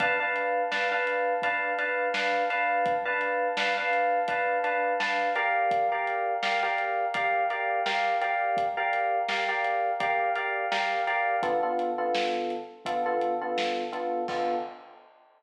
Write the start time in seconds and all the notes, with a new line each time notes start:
0.00 D4 B4 F5 A5, kick, closed hi-hat
0.20 D4 B4 F5 A5
0.36 closed hi-hat
0.71 D4 B4 F5 A5, snare
0.92 D4 B4 F5 A5
1.07 closed hi-hat
1.42 D4 B4 F5 A5, kick, closed hi-hat
1.79 D4 B4 F5 A5, closed hi-hat
2.14 D4 B4 F5 A5, snare
2.50 D4 B4 F5 A5, closed hi-hat
2.86 kick, closed hi-hat
3.05 D4 B4 F5 A5
3.21 closed hi-hat
3.57 D4 B4 F5 A5, snare
3.77 D4 B4 F5 A5
3.93 closed hi-hat
4.28 D4 B4 F5 A5, kick, closed hi-hat
4.64 D4 B4 F5 A5, closed hi-hat
5.00 D4 B4 F5 A5, snare
5.35 G4 A#4 D5 F5, closed hi-hat
5.71 kick, closed hi-hat
5.92 G4 A#4 D5 F5
6.07 closed hi-hat
6.43 G4 A#4 D5 F5, snare
6.63 G4 A#4 D5 F5
6.78 closed hi-hat
7.14 G4 A#4 D5 F5, kick, closed hi-hat
7.50 G4 A#4 D5 F5, closed hi-hat
7.86 G4 A#4 D5 F5, snare
8.21 G4 A#4 D5 F5, closed hi-hat
8.57 kick, closed hi-hat
8.77 G4 A#4 D5 F5
8.93 closed hi-hat
9.29 G4 A#4 D5 F5, snare
9.49 G4 A#4 D5 F5
9.64 closed hi-hat
10.00 G4 A#4 D5 F5, kick, closed hi-hat
10.35 G4 A#4 D5 F5, closed hi-hat
10.72 G4 A#4 D5 F5, snare
11.07 G4 A#4 D5 F5, closed hi-hat
11.43 D3 B3 F4 A4, kick, closed hi-hat
11.63 D3 B3 F4 A4
11.79 closed hi-hat
11.98 D3 B3 F4 A4
12.15 snare
12.50 closed hi-hat
12.85 D3 B3 F4 A4, kick, closed hi-hat
13.06 D3 B3 F4 A4
13.21 closed hi-hat
13.42 D3 B3 F4 A4
13.58 snare
13.92 D3 B3 F4 A4, closed hi-hat
14.28 D3 B3 F4 A4, kick, crash